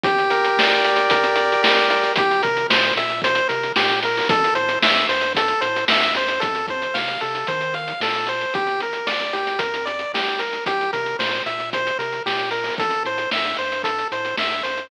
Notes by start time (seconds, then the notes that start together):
0.04 G1 G4, kick, closed hi-hat
0.18 closed hi-hat
0.30 A#4, closed hi-hat
0.44 closed hi-hat
0.57 D2 D5, snare
0.71 closed hi-hat
0.84 D2 G4, closed hi-hat
0.96 closed hi-hat
1.10 F2 A#4, kick, closed hi-hat
1.24 closed hi-hat
1.36 D5, closed hi-hat
1.52 closed hi-hat
1.62 C2 G4, snare
1.77 closed hi-hat
1.89 A#4, closed hi-hat
2.03 closed hi-hat
2.16 C2 G4, kick, closed hi-hat
2.31 closed hi-hat
2.43 C3 A#4, kick, closed hi-hat
2.57 closed hi-hat
2.70 A#2 C5, snare
2.84 closed hi-hat
2.96 A#2 E5, closed hi-hat
3.10 closed hi-hat
3.22 C5, kick, closed hi-hat
3.35 closed hi-hat
3.49 C3 A#4, closed hi-hat
3.63 closed hi-hat
3.76 A#2 G4, snare
3.89 closed hi-hat
4.03 A#4, closed hi-hat
4.17 open hi-hat
4.28 A1 A4, kick, closed hi-hat
4.44 closed hi-hat
4.55 A2 C5, closed hi-hat
4.69 closed hi-hat
4.82 G2 E5, snare
4.96 closed hi-hat
5.09 G2 C5, closed hi-hat
5.21 closed hi-hat
5.35 A4, kick, closed hi-hat
5.48 closed hi-hat
5.61 A2 C5, closed hi-hat
5.76 closed hi-hat
5.88 G2 E5, snare
6.02 closed hi-hat
6.15 F#2 C5, closed hi-hat
6.28 closed hi-hat
6.40 F2 A4, kick, closed hi-hat
6.55 closed hi-hat
6.68 C5, kick, closed hi-hat
6.82 closed hi-hat
6.94 C3 F5, snare
7.08 closed hi-hat
7.21 C3 A4, closed hi-hat
7.35 closed hi-hat
7.47 D#3 C5, kick, closed hi-hat
7.61 closed hi-hat
7.74 F5, closed hi-hat
7.88 closed hi-hat
8.00 A#2 A4, snare
8.14 closed hi-hat
8.27 C5, closed hi-hat
8.41 closed hi-hat
8.54 G1 G4, kick, closed hi-hat
8.67 closed hi-hat
8.81 A#4, closed hi-hat
8.93 closed hi-hat
9.07 D2 D5, snare
9.20 closed hi-hat
9.33 D2 G4, closed hi-hat
9.47 closed hi-hat
9.59 F2 A#4, kick, closed hi-hat
9.74 closed hi-hat
9.86 D5, closed hi-hat
9.99 closed hi-hat
10.13 C2 G4, snare
10.28 closed hi-hat
10.39 A#4, closed hi-hat
10.53 closed hi-hat
10.66 C2 G4, kick, closed hi-hat
10.81 closed hi-hat
10.93 C3 A#4, kick, closed hi-hat
11.06 closed hi-hat
11.19 A#2 C5, snare
11.31 closed hi-hat
11.46 A#2 E5, closed hi-hat
11.60 closed hi-hat
11.73 C5, kick, closed hi-hat
11.87 closed hi-hat
11.99 C3 A#4, closed hi-hat
12.12 closed hi-hat
12.26 A#2 G4, snare
12.39 closed hi-hat
12.51 A#4, closed hi-hat
12.64 open hi-hat
12.78 A1 A4, kick, closed hi-hat
12.90 closed hi-hat
13.05 A2 C5, closed hi-hat
13.18 closed hi-hat
13.31 G2 E5, snare
13.45 closed hi-hat
13.57 G2 C5, closed hi-hat
13.72 closed hi-hat
13.84 A4, kick, closed hi-hat
13.98 closed hi-hat
14.12 A2 C5, closed hi-hat
14.25 closed hi-hat
14.37 G2 E5, snare
14.51 closed hi-hat
14.63 F#2 C5, closed hi-hat
14.78 closed hi-hat